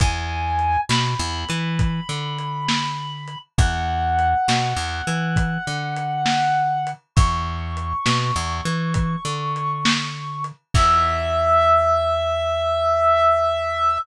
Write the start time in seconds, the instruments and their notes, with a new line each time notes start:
0.00 electric bass (finger) E2, clarinet G#5, kick, closed hi-hat
0.59 closed hi-hat
0.89 electric bass (finger) B2, clarinet B5, snare
1.19 electric bass (finger) E2
1.49 electric bass (finger) E3, closed hi-hat
1.79 kick, closed hi-hat
2.09 electric bass (finger) D3
2.38 closed hi-hat
2.69 snare
3.28 closed hi-hat
3.58 electric bass (finger) E2, clarinet F#5, kick, closed hi-hat
4.19 closed hi-hat
4.48 electric bass (finger) B2, snare
4.76 electric bass (finger) E2
5.07 electric bass (finger) E3, closed hi-hat
5.36 kick, closed hi-hat
5.67 electric bass (finger) D3
5.96 closed hi-hat
6.26 snare
6.87 closed hi-hat
7.16 electric bass (finger) E2, clarinet C#6, kick, closed hi-hat
7.77 closed hi-hat
8.06 electric bass (finger) B2, snare
8.36 electric bass (finger) E2
8.65 electric bass (finger) E3, closed hi-hat
8.94 kick, closed hi-hat
9.25 electric bass (finger) D3
9.56 closed hi-hat
9.85 snare
10.44 closed hi-hat
10.74 electric bass (finger) E2, clarinet E5, kick, crash